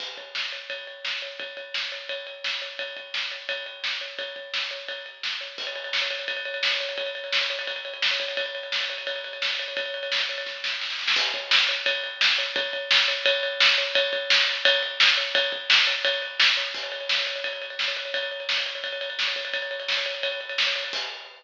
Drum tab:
CC |x---------------|----------------|----------------|----------------|
RD |--x---x-x-x---x-|x-x---x-x-x---x-|x-x---x-x-x---x-|x-x---x-x-x---x-|
SD |----o-------o---|----o-------o---|----o-------o---|----o-------o---|
BD |o-o-----o-------|o-o-----o-------|o-o-----o-------|o-o-----o-------|

CC |x---------------|----------------|----------------|----------------|
RD |-xxx-xxxxxxx-xxx|xxxx-xxxxxxx-xxx|xxxx-xxxxxxx-xxx|xxxx-xxx--------|
SD |----o-------o---|----o-------o---|----o-------o---|----o---o-o-oooo|
BD |o-------o-------|o-------o-----o-|o-------o-------|o-------o-------|

CC |x---------------|----------------|----------------|----------------|
RD |--x---x-x-x---x-|x-x---x-x-x---x-|x-x---x-x-x---x-|x-x---x-x-x---x-|
SD |----o-------o---|----o-------o---|----o-------o---|----o-------o---|
BD |o-o-----o-------|o-o-----o-------|o-o-----o-------|o-o-----o-------|

CC |x---------------|----------------|----------------|x---------------|
RD |-xxx-xxxxxxx-xxx|xxxx-xxxxxxx-xxx|xxxx-xxxxxxx-xxx|----------------|
SD |----o-------o---|----o-------o---|----o-------o---|----------------|
BD |o-------o-------|o-------o-----o-|o-------o-------|o---------------|